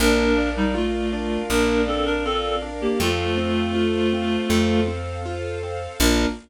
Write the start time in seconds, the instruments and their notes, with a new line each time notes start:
0.00 electric bass (finger) A#1, acoustic grand piano A#3, clarinet D4 A#4, string ensemble 1 A#4 D5 F5
0.38 acoustic grand piano D4
0.57 clarinet G3 D#4
0.75 clarinet A3 F4, acoustic grand piano F4
1.13 acoustic grand piano D4
1.49 electric bass (finger) A#1, acoustic grand piano A#3, clarinet D4 A#4
1.87 clarinet C4 A4, acoustic grand piano D4
2.05 clarinet D4 A#4
2.25 clarinet C4 A4, acoustic grand piano F4
2.62 acoustic grand piano D4
2.81 clarinet A#3 G4
3.00 electric bass (finger) F2, acoustic grand piano A3, clarinet A3 F4, string ensemble 1 A4 C5 F5
3.38 acoustic grand piano C4
3.75 acoustic grand piano F4
4.13 acoustic grand piano C4
4.50 electric bass (finger) F2, acoustic grand piano A3
4.88 acoustic grand piano C4
5.26 acoustic grand piano F4
5.63 acoustic grand piano C4
6.00 electric bass (finger) A#1, acoustic grand piano A#3 D4 F4, string ensemble 1 A#3 D4 F4, clarinet A#4